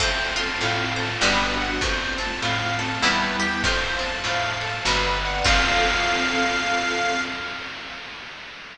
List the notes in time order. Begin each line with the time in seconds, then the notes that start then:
0.00 F2 A3 C4 F4 A4 C5, kick, crash
0.36 F4 A5, ride
0.60 A2 A4 F5, ride
0.96 C5 A5, ride
1.21 G1 G3 B3 D4 F#4 G4 B4, snare
1.57 F#5, ride
1.81 F2 A3 C4 F4 C5, kick, ride
2.18 C4 A5, ride
2.42 A2 F4 F5, ride
2.79 A4 A5, ride
3.02 E2 G3 B3 E4 B4, snare
3.39 G4 G5, ride
3.64 F2 A3 F4 C5 F5 A5, kick, ride
3.99 C4 A5, ride
4.24 A2 F4 F5, ride
4.61 A4 A5, ride
4.85 G1 G3 B3 D4 F#4 B4 D5 F#5 G5, snare
5.21 F#5, ride
5.44 F2 C4 F4 A4 F5, kick, crash